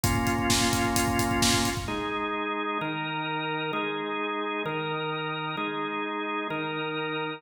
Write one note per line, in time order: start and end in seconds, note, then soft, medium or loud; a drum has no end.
0.04 1.70 A#3 medium
0.04 1.70 C#4 medium
0.04 1.70 F4 medium
0.04 kick medium
0.04 closed hi-hat medium
0.15 kick medium
0.27 kick medium
0.27 closed hi-hat soft
0.38 kick medium
0.50 kick medium
0.50 snare medium
0.61 kick medium
0.73 kick medium
0.73 closed hi-hat medium
0.85 kick medium
0.96 kick medium
0.96 closed hi-hat medium
1.08 kick medium
1.19 kick medium
1.19 closed hi-hat medium
1.31 kick medium
1.42 kick medium
1.42 snare medium
1.54 kick medium
1.65 kick medium
1.65 closed hi-hat soft
1.77 kick medium
1.88 2.78 G#3 medium
1.88 2.78 D#4 medium
1.88 2.78 G#4 medium
2.81 3.72 D#3 medium
2.81 3.72 D#4 medium
2.81 3.72 A#4 medium
3.73 4.63 G#3 medium
3.73 4.63 D#4 medium
3.73 4.63 G#4 medium
4.65 5.56 D#3 medium
4.65 5.56 D#4 medium
4.65 5.56 A#4 medium
5.57 6.48 G#3 medium
5.57 6.48 D#4 medium
5.57 6.48 G#4 medium
6.50 7.41 D#3 medium
6.50 7.41 D#4 medium
6.50 7.41 A#4 medium